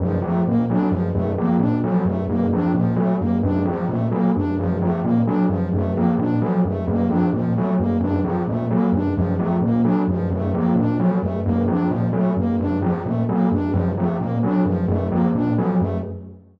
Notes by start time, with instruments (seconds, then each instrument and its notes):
0.00 tubular bells F#2, ocarina F3
0.22 tubular bells F3, ocarina A3
0.46 tubular bells A#2, ocarina A#3
0.70 tubular bells F#3, ocarina D4
0.91 tubular bells F#2, ocarina F3
1.13 tubular bells F#2, ocarina A3
1.38 tubular bells F3, ocarina A#3
1.59 tubular bells A#2, ocarina D4
1.84 ocarina F3, tubular bells F#3
2.05 tubular bells F#2, ocarina A3
2.29 tubular bells F#2, ocarina A#3
2.53 tubular bells F3, ocarina D4
2.74 tubular bells A#2, ocarina F3
2.96 tubular bells F#3, ocarina A3
3.19 tubular bells F#2, ocarina A#3
3.43 tubular bells F#2, ocarina D4
3.65 tubular bells F3, ocarina F3
3.89 tubular bells A#2, ocarina A3
4.11 tubular bells F#3, ocarina A#3
4.36 tubular bells F#2, ocarina D4
4.59 tubular bells F#2, ocarina F3
4.82 tubular bells F3, ocarina A3
5.03 tubular bells A#2, ocarina A#3
5.26 tubular bells F#3, ocarina D4
5.49 tubular bells F#2, ocarina F3
5.73 tubular bells F#2, ocarina A3
5.95 tubular bells F3, ocarina A#3
6.18 tubular bells A#2, ocarina D4
6.41 ocarina F3, tubular bells F#3
6.65 tubular bells F#2, ocarina A3
6.87 tubular bells F#2, ocarina A#3
7.10 tubular bells F3, ocarina D4
7.33 tubular bells A#2, ocarina F3
7.56 tubular bells F#3, ocarina A3
7.79 tubular bells F#2, ocarina A#3
8.00 tubular bells F#2, ocarina D4
8.24 tubular bells F3, ocarina F3
8.48 tubular bells A#2, ocarina A3
8.70 tubular bells F#3, ocarina A#3
8.92 tubular bells F#2, ocarina D4
9.16 tubular bells F#2, ocarina F3
9.38 tubular bells F3, ocarina A3
9.61 tubular bells A#2, ocarina A#3
9.84 tubular bells F#3, ocarina D4
10.08 tubular bells F#2, ocarina F3
10.30 tubular bells F#2, ocarina A3
10.54 tubular bells F3, ocarina A#3
10.75 tubular bells A#2, ocarina D4
11.00 ocarina F3, tubular bells F#3
11.21 tubular bells F#2, ocarina A3
11.44 tubular bells F#2, ocarina A#3
11.67 tubular bells F3, ocarina D4
11.89 tubular bells A#2, ocarina F3
12.13 tubular bells F#3, ocarina A3
12.37 tubular bells F#2, ocarina A#3
12.59 tubular bells F#2, ocarina D4
12.82 tubular bells F3, ocarina F3
13.05 tubular bells A#2, ocarina A3
13.29 tubular bells F#3, ocarina A#3
13.51 tubular bells F#2, ocarina D4
13.73 tubular bells F#2, ocarina F3
13.97 tubular bells F3, ocarina A3
14.19 tubular bells A#2, ocarina A#3
14.43 tubular bells F#3, ocarina D4
14.65 tubular bells F#2, ocarina F3
14.88 tubular bells F#2, ocarina A3
15.11 tubular bells F3, ocarina A#3
15.34 tubular bells A#2, ocarina D4
15.57 ocarina F3, tubular bells F#3
15.79 tubular bells F#2, ocarina A3